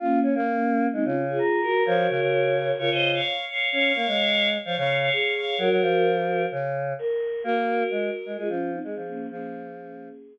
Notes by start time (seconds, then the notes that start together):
0.00 A#3 C#4 F4
0.23 C#4
0.35 A#3
0.93 G#3 C4 D#4
1.05 C#3 C#4 F4
1.28 F4 G#4
1.38 A#5
1.62 F#4 A#4
1.86 F3 F#4 A#4 C#5
2.09 C#3
2.21 C#3
2.32 C#5
2.79 C#3 F4 A#4 C#5
2.91 C#3 C5 D#5
3.14 C#5 F5
3.48 C#5 F5
3.71 C#4 C#5 F5
3.95 A#3
4.07 G#3
4.65 F3 C#5 F5
4.77 C#3 C#5 F5
5.01 C#5 F5
5.12 G#4
5.35 C#5 F5
5.58 F#3 F#4 A#4
5.70 F#3
5.82 F3
6.51 C#3
6.99 A#4
7.44 A#3 F#4 A#4
7.91 G#3
8.26 G#3
8.37 G#3 F4 G#4
8.48 F3 C#4 F4
8.72 C4 D#4
8.84 G#3 G#4
8.95 F3
9.08 A#3 C#4
9.30 F3 A#3 C#4 G#4